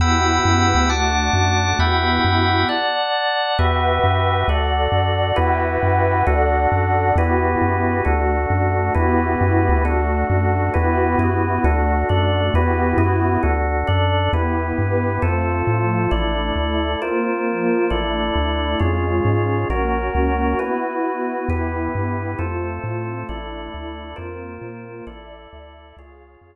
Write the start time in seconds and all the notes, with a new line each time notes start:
0.00 E2 B3 E4 F#4 G4 F#5 G5 B5 E6
0.45 F#2
0.75 D2
0.89 A3 D4 F#4 F#5 A5 D6
1.33 F#2
1.79 E2 B3 E4 F#4 G4 E5 F#5 G5 B5
2.25 F#2
2.69 D5 F#5 A5
3.59 E2 F#4 G4 B4 E5 F#5 G5
4.04 F#2
4.47 D2 F#4 A4 D5 F#5
4.92 F#2
5.36 E2 E4 F#4 G4 B4 E5 F#5 G5
5.83 F#2
6.27 D2 D4 F#4 A4 D5 F#5
6.72 F#2
7.16 E2 B3 E4 F#4 G4 B4
7.62 F#2
8.05 D2 A3 D4 F#4 A4
8.50 F#2
8.95 E2 B3 E4 F#4 G4 B4
9.41 F#2
9.69 D2
9.85 A3 D4 F#4 A4
10.30 F#2
10.74 E2 B3 E4 F#4 G4 B4
11.19 F#2 B3 E4 F#4 B4
11.64 D2 A3 D4 F#4 A4
12.09 F#2 D4 A4 D5
12.54 E2 B3 E4 F#4 G4 B4
12.97 F#2 B3 E4 F#4 B4
13.43 D2 D4 F#4 A4
13.87 F#2 D4 A4 D5
14.33 E2 B3 E4 G4 B4
14.77 G2 B3 G4 B4
15.22 F2 A3 C4 F4 A4 C5
15.67 A2 F3 A3 F4
16.11 A1 A3 D4 E4 A4 D5
16.56 D2 A3 E4 A4
17.02 A#3 C4 F4 A#4 C5
17.47 F3 A#3 F4
17.90 A1 A3 D4 E4 A4 D5
18.36 D2
18.80 F2 G#3 C#4 F4 G#4 C#5
19.25 G#2
19.70 A#1 A#3 C#4 F#4 A#4 C#5
20.15 C#2
20.59 B3 E4 F#4 B4
21.49 E2 B3 E4 G4 B4
21.95 G2
22.38 F2 A3 C4 F4 A4 C5
22.84 A2
23.28 A1 A3 D4 E4 A4 D5
23.74 D2
24.16 F2 A#3 C4 F4 A#4 C5
24.62 A#2
25.07 A1 E4 A4 D5 E5
25.53 D2
25.97 C#2 F4 G#4 C#5 F5
26.41 F2